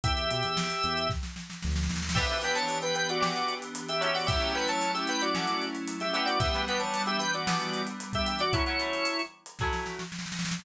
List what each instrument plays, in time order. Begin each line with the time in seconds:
0.04 synth bass 1 E2, drawbar organ G4 E5, kick, closed hi-hat
0.17 closed hi-hat
0.31 synth bass 1 B2, closed hi-hat
0.43 synth bass 1 E2, closed hi-hat
0.57 snare
0.70 closed hi-hat
0.84 synth bass 1 E2, closed hi-hat
0.97 closed hi-hat
1.10 kick, snare
1.23 snare
1.36 snare
1.50 snare
1.62 synth bass 1 D2, snare
1.69 snare
1.76 snare
1.83 snare
1.89 synth bass 1 D#2, snare
1.96 snare
2.03 snare
2.09 snare
2.15 acoustic guitar (steel) E3 D4 G4 B4, electric piano 2 E3 B3 D4 G4, drawbar organ G4 E5, kick, crash
2.30 acoustic guitar (steel) E3 D4 G4, closed hi-hat
2.34 acoustic guitar (steel) B4
2.42 acoustic guitar (steel) E3 D4 G4 B4, drawbar organ B4 G5, snare, closed hi-hat
2.55 drawbar organ C#5 A5, snare, closed hi-hat
2.69 closed hi-hat
2.82 drawbar organ B4 G5, snare, closed hi-hat
2.95 drawbar organ B4 G5, closed hi-hat
3.09 drawbar organ F#4 D5, closed hi-hat
3.20 acoustic guitar (steel) E3 D4 G4 B4, snare
3.36 closed hi-hat
3.48 closed hi-hat
3.62 closed hi-hat
3.75 closed hi-hat
3.89 drawbar organ G4 E5, closed hi-hat
4.01 acoustic guitar (steel) F#3 C#4 E4 A4, drawbar organ G4 E5, closed hi-hat
4.14 drawbar organ F#4 D5, open hi-hat
4.27 electric piano 2 F#3 A3 C#4 E4, drawbar organ G4 E5, kick, closed hi-hat
4.41 acoustic guitar (steel) F#3 C#4 E4 A4, closed hi-hat
4.54 acoustic guitar (steel) F#3 C#4 E4 A4, drawbar organ B4 G5
4.68 drawbar organ C#5 A5, closed hi-hat
4.81 closed hi-hat
4.94 drawbar organ G4 E5, closed hi-hat
5.07 drawbar organ B4 G5, closed hi-hat
5.21 drawbar organ F#4 D5, closed hi-hat
5.34 acoustic guitar (steel) F#3 C#4 E4 A4, snare
5.47 closed hi-hat
5.62 closed hi-hat
5.75 closed hi-hat
5.88 closed hi-hat
6.00 drawbar organ G4 E5, snare, closed hi-hat
6.13 acoustic guitar (steel) E3 B3 D4 G4, drawbar organ G4 E5, closed hi-hat
6.26 drawbar organ F#4 D5, closed hi-hat
6.40 electric piano 2 E3 G3 B3 D4, drawbar organ G4 E5, kick, closed hi-hat
6.54 acoustic guitar (steel) E3 B3 D4 G4, closed hi-hat
6.67 acoustic guitar (steel) E3 B3 D4 G4, drawbar organ B4 G5, closed hi-hat
6.80 drawbar organ C#5 A5, snare, closed hi-hat
6.94 closed hi-hat
7.06 drawbar organ G4 E5, closed hi-hat
7.19 drawbar organ B4 G5, closed hi-hat
7.34 drawbar organ F#4 D5, closed hi-hat
7.47 acoustic guitar (steel) E3 B3 D4 G4, snare
7.60 closed hi-hat
7.74 closed hi-hat
7.87 closed hi-hat
8.00 closed hi-hat
8.13 drawbar organ G4 E5, kick, closed hi-hat
8.26 drawbar organ G4 E5, closed hi-hat
8.39 drawbar organ F#4 D5, closed hi-hat
8.53 acoustic guitar (steel) F#3 A3 C#4 E4, drawbar organ E4 C#5, kick, closed hi-hat
8.66 acoustic guitar (steel) F#3 A3 C#4 E4, closed hi-hat
8.78 acoustic guitar (steel) F#3 A3 C#4 E4, closed hi-hat
8.93 closed hi-hat
9.05 closed hi-hat
9.19 closed hi-hat
9.46 closed hi-hat
9.59 acoustic guitar (steel) F#3 A3 C#4, kick, snare
9.64 acoustic guitar (steel) E4
9.73 snare
9.86 snare
9.99 snare
10.12 snare
10.19 snare
10.26 snare
10.32 snare
10.39 snare
10.45 snare
10.51 snare
10.59 snare